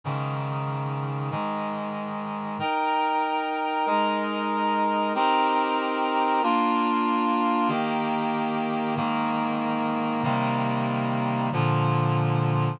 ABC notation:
X:1
M:4/4
L:1/8
Q:1/4=94
K:Ab
V:1 name="Clarinet"
[A,,D,E,]4 [A,,E,A,]4 | [K:Eb] [EBg]4 [A,EB]4 | [CEGB]4 [B,DF]4 | [E,B,G]4 [A,,E,B,]4 |
[C,E,G,B,]4 [B,,D,F,]4 |]